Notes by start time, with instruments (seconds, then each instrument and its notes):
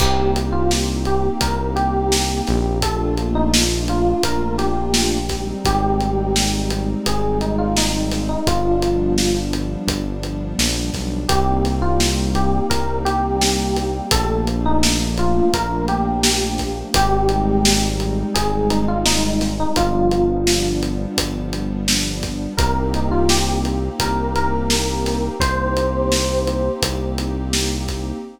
0.00 synth bass 1 C2, pad 2 (warm) A#3 C4 D#4 G4, electric piano 1 G4, kick, crash
0.36 closed hi-hat
0.52 electric piano 1 F4
0.71 snare
1.05 electric piano 1 G4, closed hi-hat
1.41 synth bass 1 C2, electric piano 1 A#4, kick, closed hi-hat
1.76 electric piano 1 G4, closed hi-hat
2.12 snare
2.47 synth bass 1 A#1, snare, closed hi-hat
2.82 pad 2 (warm) A3 A#3 D4 F4, electric piano 1 A4, kick, closed hi-hat
3.17 closed hi-hat
3.35 electric piano 1 D#4
3.54 snare
3.88 electric piano 1 F4, closed hi-hat
4.23 synth bass 1 A#1, electric piano 1 A#4, kick, closed hi-hat
4.58 electric piano 1 G4, snare, closed hi-hat
4.94 snare
5.29 pad 2 (warm) G3 G#3 C4 D#4, kick, snare, closed hi-hat
5.65 synth bass 1 G#1, electric piano 1 G4, kick, closed hi-hat
6.00 closed hi-hat
6.36 snare
6.70 closed hi-hat
7.06 synth bass 1 G#1, electric piano 1 G#4, kick, closed hi-hat
7.41 electric piano 1 D#4, closed hi-hat
7.58 electric piano 1 F4
7.76 electric piano 1 D#4, snare
8.11 snare, closed hi-hat
8.29 electric piano 1 D#4
8.47 synth bass 1 G1, pad 2 (warm) F3 G3 B3 D4, electric piano 1 F4, kick, closed hi-hat
8.82 closed hi-hat
9.18 snare
9.53 closed hi-hat
9.87 synth bass 1 G1, kick, closed hi-hat
10.23 closed hi-hat
10.59 synth bass 1 A#1, snare
10.94 synth bass 1 B1, kick, snare, closed hi-hat
11.28 synth bass 1 C2, pad 2 (warm) G3 A#3 C4 D#4, electric piano 1 G4, kick, closed hi-hat
11.65 snare, closed hi-hat
11.82 electric piano 1 F4
12.00 snare
12.35 electric piano 1 G4, closed hi-hat
12.70 synth bass 1 C2, electric piano 1 A#4, kick, closed hi-hat
13.05 electric piano 1 G4, closed hi-hat
13.41 snare
13.76 snare, closed hi-hat
14.11 synth bass 1 A#1, pad 2 (warm) F3 A3 A#3 D4, electric piano 1 A4, kick, closed hi-hat
14.47 closed hi-hat
14.66 electric piano 1 D#4
14.83 snare
15.17 electric piano 1 F4, closed hi-hat
15.54 synth bass 1 A#1, electric piano 1 A#4, kick, closed hi-hat
15.88 electric piano 1 G4, closed hi-hat
16.23 snare
16.58 kick, snare, closed hi-hat
16.94 synth bass 1 G#1, pad 2 (warm) G3 G#3 C4 D#4, electric piano 1 G4, kick, closed hi-hat
17.29 closed hi-hat
17.65 snare
18.00 closed hi-hat
18.34 synth bass 1 G#1, electric piano 1 G#4, kick, closed hi-hat
18.70 electric piano 1 D#4, closed hi-hat
18.88 electric piano 1 F4
19.06 electric piano 1 D#4, snare
19.41 snare, closed hi-hat
19.60 electric piano 1 D#4
19.76 synth bass 1 G1, pad 2 (warm) F3 G3 B3 D4, electric piano 1 F4, kick, closed hi-hat
20.11 closed hi-hat
20.47 snare
20.83 closed hi-hat
21.18 synth bass 1 G1, kick, closed hi-hat
21.53 closed hi-hat
21.88 snare
22.23 kick, snare, closed hi-hat
22.57 synth bass 1 C2, pad 2 (warm) A#3 C4 D#4 G4, electric piano 1 A#4, kick, closed hi-hat
22.94 electric piano 1 D#4, closed hi-hat
23.11 electric piano 1 F4
23.29 electric piano 1 G4, snare
23.65 closed hi-hat
23.99 synth bass 1 C2, electric piano 1 A#4, kick, closed hi-hat
24.36 electric piano 1 A#4, closed hi-hat
24.70 snare
25.06 snare, closed hi-hat
25.40 synth bass 1 C2, pad 2 (warm) A#3 C4 D#4 G4, electric piano 1 C5, kick, closed hi-hat
25.77 closed hi-hat
26.12 snare
26.47 closed hi-hat
26.82 synth bass 1 C2, kick, closed hi-hat
27.18 closed hi-hat
27.53 snare
27.88 kick, snare, closed hi-hat